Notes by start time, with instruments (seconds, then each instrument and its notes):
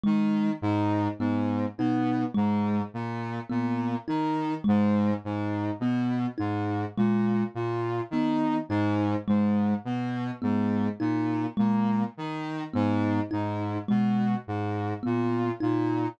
0.04 lead 2 (sawtooth) D#3, kalimba G#3
0.62 lead 2 (sawtooth) G#2
1.19 lead 2 (sawtooth) G#2, kalimba B3
1.78 lead 2 (sawtooth) B2, kalimba D#4
2.34 lead 2 (sawtooth) G#2, kalimba G#3
2.94 lead 2 (sawtooth) A#2
3.50 lead 2 (sawtooth) A#2, kalimba B3
4.08 lead 2 (sawtooth) D#3, kalimba D#4
4.64 lead 2 (sawtooth) G#2, kalimba G#3
5.24 lead 2 (sawtooth) G#2
5.80 lead 2 (sawtooth) B2, kalimba B3
6.38 lead 2 (sawtooth) G#2, kalimba D#4
6.97 lead 2 (sawtooth) A#2, kalimba G#3
7.55 lead 2 (sawtooth) A#2
8.11 lead 2 (sawtooth) D#3, kalimba B3
8.69 lead 2 (sawtooth) G#2, kalimba D#4
9.28 lead 2 (sawtooth) G#2, kalimba G#3
9.85 lead 2 (sawtooth) B2
10.42 lead 2 (sawtooth) G#2, kalimba B3
11.00 lead 2 (sawtooth) A#2, kalimba D#4
11.57 lead 2 (sawtooth) A#2, kalimba G#3
12.17 lead 2 (sawtooth) D#3
12.74 lead 2 (sawtooth) G#2, kalimba B3
13.31 lead 2 (sawtooth) G#2, kalimba D#4
13.88 lead 2 (sawtooth) B2, kalimba G#3
14.47 lead 2 (sawtooth) G#2
15.03 lead 2 (sawtooth) A#2, kalimba B3
15.60 lead 2 (sawtooth) A#2, kalimba D#4